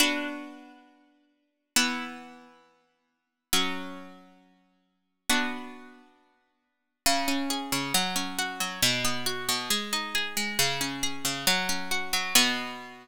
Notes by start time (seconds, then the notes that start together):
0.00 B3 D4 F#4
1.76 E3 B3 E4
3.53 F#3 C#4 F#4
5.30 B3 D4 F#4
7.06 C#3
7.28 C#4
7.50 G#4
7.72 C#3
7.94 F#3
8.16 C#4
8.39 F#4
8.60 F#3
8.82 B2
9.05 B3
9.26 F#4
9.49 B2
9.70 G#3
9.93 D#4
10.15 G#4
10.37 G#3
10.59 C#3
10.81 C#4
11.03 G#4
11.25 C#3
11.47 F#3
11.69 C#4
11.91 F#4
12.13 F#3
12.35 B2 B3 F#4